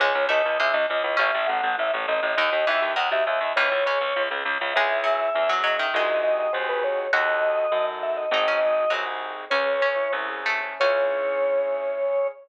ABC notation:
X:1
M:2/2
L:1/8
Q:1/2=101
K:C#m
V:1 name="Drawbar Organ"
c2 d2 e d d2 | e2 f2 e z d2 | d2 e2 f e e2 | c5 z3 |
e6 d e | d2 d d ^B =B c2 | d6 e d | d5 z3 |
"^rit." c5 z3 | c8 |]
V:2 name="Harpsichord"
G,2 A,2 G,3 z | C4 z4 | D,2 E,2 D,3 z | E,2 C4 z2 |
G,2 F,2 z F, F, D, | G,8 | F8 | D C z2 F, z3 |
"^rit." C2 C4 A,2 | C8 |]
V:3 name="Acoustic Grand Piano"
C E G C E G C E | C E A C E A C E | B, D F B, D F B, D | C E G C E G C E |
[CEG]4 [CEG]4 | [^B,DFG]4 [B,DFG]4 | [DFA]4 [DFA]4 | [^B,DFG]4 [B,DFG]4 |
"^rit." C G C E C G E C | [CEG]8 |]
V:4 name="Harpsichord" clef=bass
C,, C,, C,, C,, C,, C,, C,, C,, | A,,, A,,, A,,, A,,, A,,, A,,, A,,, A,,, | D,, D,, D,, D,, D,, D,, D,, D,, | C,, C,, C,, C,, C,, C,, C,, C,, |
C,,4 E,,4 | ^B,,,4 D,,4 | D,,4 F,,4 | G,,,4 ^B,,,4 |
"^rit." C,,4 ^B,,,4 | C,,8 |]